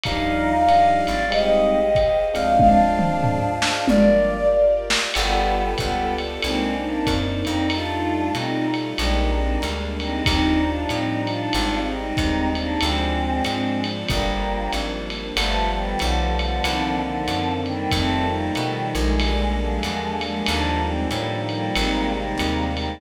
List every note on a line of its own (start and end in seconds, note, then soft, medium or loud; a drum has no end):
0.03 1.03 D#2 medium
0.03 0.54 F3 medium
0.03 0.54 G3 medium
0.03 0.54 D4 medium
0.03 0.66 D#4 medium
0.03 0.54 D#4 medium
0.03 1.30 F4 medium
0.03 1.30 G4 medium
0.03 1.30 D5 medium
0.03 1.30 D#5 medium
0.03 1.24 F5 medium
0.03 kick medium
0.03 ride loud
0.68 1.16 F3 medium
0.68 1.16 G3 medium
0.68 1.16 D4 medium
0.68 1.16 D#4 medium
0.68 1.00 D#5 medium
0.68 hi-hat pedal medium
0.68 ride medium
1.06 2.28 G#1 medium
1.06 1.27 D5 medium
1.06 ride medium
1.30 1.79 G3 medium
1.30 1.79 G#3 medium
1.30 1.79 C4 medium
1.30 1.79 D#4 medium
1.30 2.57 G4 medium
1.30 2.19 G4 medium
1.30 2.57 G#4 medium
1.30 2.57 C5 medium
1.30 2.57 D#5 medium
1.30 1.70 D#5 medium
1.30 ride loud
1.70 2.25 D#5 medium
1.95 kick medium
1.95 hi-hat pedal medium
1.95 ride medium
2.34 3.68 D2 medium
2.34 2.86 F3 medium
2.34 2.86 G#3 medium
2.34 2.86 C4 medium
2.34 2.86 D4 medium
2.34 2.57 F5 medium
2.34 ride medium
2.59 3.77 D4 medium
2.59 3.86 F4 medium
2.59 3.87 G#4 medium
2.59 3.87 C5 medium
2.59 3.86 D5 medium
2.59 3.72 F5 medium
2.59 kick medium
2.59 high tom medium
2.99 3.39 F3 medium
2.99 3.39 G#3 medium
2.99 3.39 C4 medium
2.99 3.39 D4 medium
2.99 mid tom medium
3.24 floor tom medium
3.62 snare medium
3.86 4.96 G1 medium
3.86 4.37 F3 medium
3.86 4.37 G3 medium
3.86 4.37 A#3 medium
3.86 4.37 D4 medium
3.86 5.13 F4 medium
3.86 5.13 G4 medium
3.86 5.13 A#4 medium
3.86 5.13 D5 medium
3.86 4.47 D5 medium
3.86 high tom medium
4.90 snare loud
5.14 5.75 G1 loud
5.14 5.70 G3 medium
5.14 5.70 B3 medium
5.14 6.42 B3 medium
5.14 6.42 F4 loud
5.14 6.42 G4 loud
5.14 6.42 A4 loud
5.14 crash loud
5.14 ride loud
5.78 6.39 C#2 medium
5.78 6.13 G3 medium
5.78 6.13 B3 medium
5.78 kick medium
5.78 hi-hat pedal medium
5.78 ride medium
6.18 ride medium
6.42 7.03 C2 medium
6.42 6.75 G#3 medium
6.42 7.68 A#3 loud
6.42 7.68 C4 medium
6.42 6.75 C4 medium
6.42 7.68 D4 medium
6.42 7.68 D#4 loud
6.42 ride loud
6.81 7.05 A#3 medium
6.81 7.05 D4 medium
7.07 7.44 F#2 medium
7.07 kick medium
7.07 hi-hat pedal medium
7.07 ride loud
7.45 8.31 F2 loud
7.45 7.67 C4 medium
7.45 7.67 D#4 medium
7.45 ride medium
7.70 8.96 G3 loud
7.70 8.96 A3 loud
7.70 8.31 D4 medium
7.70 8.96 D#4 medium
7.70 8.96 F4 loud
7.70 8.31 F4 medium
7.70 ride loud
8.35 8.94 B2 medium
8.35 8.66 C4 medium
8.35 8.66 D#4 medium
8.35 hi-hat pedal medium
8.35 ride medium
8.74 ride medium
8.97 9.58 A#1 loud
8.97 10.24 G3 loud
8.97 10.24 G#3 loud
8.97 10.24 A#3 medium
8.97 10.24 D4 loud
8.97 9.31 D#4 medium
8.97 9.31 G4 medium
8.97 ride loud
9.35 9.59 C4 medium
9.35 9.59 D#4 medium
9.62 10.22 D2 medium
9.62 hi-hat pedal medium
9.62 ride medium
10.00 10.24 C4 medium
10.00 10.24 D#4 medium
10.00 ride medium
10.25 10.86 D#2 loud
10.25 11.52 F3 medium
10.25 11.52 G3 medium
10.25 10.61 C4 medium
10.25 11.52 D4 loud
10.25 10.61 D#4 medium
10.25 11.52 D#4 medium
10.25 kick medium
10.25 ride loud
10.65 10.87 D4 medium
10.65 10.87 F4 medium
10.89 11.49 A2 medium
10.89 11.22 C4 medium
10.89 11.22 D#4 medium
10.89 hi-hat pedal medium
10.89 ride medium
11.27 11.78 D4 medium
11.27 11.78 F4 medium
11.27 ride medium
11.53 12.13 G#1 loud
11.53 12.80 G3 loud
11.53 12.79 G#3 medium
11.53 12.79 C4 medium
11.53 12.80 D#4 medium
11.53 ride loud
11.91 12.49 C4 medium
11.91 12.49 D#4 medium
12.17 12.77 D#2 medium
12.17 kick medium
12.17 hi-hat pedal medium
12.17 ride medium
12.55 12.78 A#3 medium
12.55 12.78 D4 medium
12.55 ride medium
12.80 13.41 D2 loud
12.80 14.06 F3 loud
12.80 14.06 G#3 medium
12.80 13.42 G#3 medium
12.80 14.06 C4 medium
12.80 13.42 C4 medium
12.80 14.06 D4 medium
12.80 ride loud
13.44 14.05 G#2 medium
13.44 13.80 G#3 medium
13.44 13.80 C4 medium
13.44 hi-hat pedal loud
13.44 ride loud
13.84 ride medium
14.08 14.68 G1 loud
14.08 15.35 F3 medium
14.08 14.70 G3 medium
14.08 15.35 G3 medium
14.08 14.70 A#3 medium
14.08 15.35 A#3 medium
14.08 15.35 D4 medium
14.08 kick medium
14.08 ride loud
14.72 15.32 G#1 medium
14.72 hi-hat pedal medium
14.72 ride medium
15.10 ride medium
15.36 15.95 G1 loud
15.36 16.62 F3 loud
15.36 15.68 F3 medium
15.36 16.62 G3 loud
15.36 16.62 A3 medium
15.36 15.68 A3 medium
15.36 16.62 B3 medium
15.36 ride loud
15.75 15.99 D#3 medium
15.75 15.99 G3 medium
15.99 16.60 B1 loud
15.99 16.34 D3 medium
15.99 16.34 F3 medium
15.99 hi-hat pedal loud
15.99 ride loud
16.39 16.99 D3 medium
16.39 16.99 F3 medium
16.39 ride medium
16.62 17.23 C2 loud
16.62 17.89 D3 medium
16.62 17.89 D#3 medium
16.62 17.89 A#3 medium
16.62 17.89 C4 loud
16.62 ride loud
17.01 17.50 D3 medium
17.01 17.50 F3 medium
17.28 17.87 F#2 medium
17.28 hi-hat pedal loud
17.28 ride medium
17.66 17.91 D#3 medium
17.66 17.91 G3 medium
17.66 ride medium
17.91 18.51 F2 loud
17.91 19.19 D#3 loud
17.91 19.19 F3 medium
17.91 19.19 G3 medium
17.91 18.26 A3 medium
17.91 19.19 A3 loud
17.91 18.26 C4 medium
17.91 kick medium
17.91 ride loud
18.29 18.51 G3 medium
18.29 18.51 A#3 medium
18.55 18.93 B2 medium
18.55 18.91 D#3 medium
18.55 18.91 G3 medium
18.55 hi-hat pedal medium
18.55 ride medium
18.93 19.79 A#1 loud
18.93 19.53 G#3 medium
18.93 ride medium
19.20 20.46 D3 loud
19.20 20.46 G3 loud
19.20 20.46 G#3 loud
19.20 20.46 A#3 medium
19.20 ride loud
19.57 20.13 F3 medium
19.57 20.13 G#3 medium
19.83 20.43 E2 medium
19.83 hi-hat pedal medium
19.83 ride medium
20.21 20.44 F3 medium
20.21 20.44 G#3 medium
20.21 ride medium
20.46 21.07 D#2 loud
20.46 21.74 D3 medium
20.46 21.74 D#3 medium
20.46 21.74 F3 loud
20.46 21.74 G3 loud
20.46 20.78 A#3 medium
20.46 20.78 D4 medium
20.46 ride loud
20.85 21.07 G#3 medium
20.85 21.07 C4 medium
21.10 21.70 A2 medium
21.10 21.41 G3 medium
21.10 21.41 A#3 medium
21.10 hi-hat pedal loud
21.10 ride medium
21.49 22.12 G3 medium
21.49 22.12 A#3 medium
21.49 ride medium
21.74 22.35 G#1 loud
21.74 23.01 C3 loud
21.74 23.01 D#3 loud
21.74 23.01 G3 loud
21.74 23.01 G#3 loud
21.74 ride loud
22.13 22.64 G3 medium
22.13 22.64 A#3 medium
22.38 22.98 D#2 medium
22.38 hi-hat pedal medium
22.38 ride loud
22.77 22.98 G3 medium
22.77 22.98 A#3 medium
22.77 ride medium